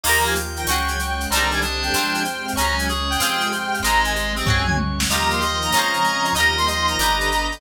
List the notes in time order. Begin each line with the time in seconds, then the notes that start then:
0.04 D#2 D#3 F3 A#3 D#4 F4 G4 A#4 D#5 A#5, crash
0.09 A#4
0.25 F5 G#5, shaker
0.35 D#3 F3 F4 A#4 G5, shaker
0.56 G5 A#5, shaker
0.67 C#2 C#3 F#3 C#4 F#4 G#4 C#5, tambourine, shaker
0.72 G#4
0.88 G#5, shaker
0.98 C#3 G#3 G#4 C#5, shaker
1.20 F#5, shaker
1.30 C2 C3 D3 D#3 G3 C4 D4 C5 A#5, shaker
1.35 D#4 G4
1.51 D5 G#5, shaker
1.61 C3 D3 G3 C4 D4 D#5, shaker
1.82 G5, shaker
1.93 F2 C3 F3 G#3 C4 F4 C5, tambourine, shaker
1.98 G#4
2.14 G#5, shaker
2.25 C3 G#3 C4 C5, shaker
2.46 F5, shaker
2.56 C#2 C#3 F#3 G#3 C#4 F#4 C#5 A#5, shaker
2.61 G#4
2.78 G#5, shaker
2.88 C#3 G#3 C#4 G#4 C#5, shaker
3.10 F#5 G5, shaker
3.20 F2 C3 F3 G#3 C4 F4 G#4 C5, tambourine, shaker
3.40 G#5, shaker
3.52 C3 G#3 C4 C5, shaker
3.72 F5, shaker
3.83 G#1 C3 D#3 G#3 C4 D#4 G#4 C5 A#5, shaker
4.04 G#5, shaker
4.15 C3 G#3 C4 C5, shaker
4.36 C4 D#5, shaker
4.46 C#2 C#3 F#3 G#3 C#4 F#4 C#5 G#5, kick, floor tom
4.50 G#4
4.67 G#5, mid tom
4.77 C#3 G#3 C#4 C#5, high tom
4.99 F#5, snare
5.09 D#2 D#3 F3 G3 A#3 D#4 F4 G4 D#5 A#5, shaker
5.13 G4 A#4
5.30 F5 C6, shaker
5.41 D#3 F3 A#3 D#4 D#5 G5, shaker
5.62 A#5, shaker
5.72 F2 C#3 F3 G#3 C4 C#4 F4 C#5, tambourine, shaker
5.77 G#4 C5
5.93 F5, shaker
6.04 C#3 F3 C4 C#4 G#5, shaker
6.25 C6, shaker
6.35 D#2 D#3 F3 G3 A#3 D#4 F4 G4 D#5 A#5, shaker
6.40 A#4
6.57 F5 C6, shaker
6.66 D#3 F3 A#3 D#4 D#5 G5, shaker
6.88 A#5, shaker
6.98 G1 D3 G3 B3 D4 G4 D5, tambourine, shaker
7.03 B4
7.21 B5, shaker
7.30 D3 B3 D4 D5, shaker
7.52 G5, shaker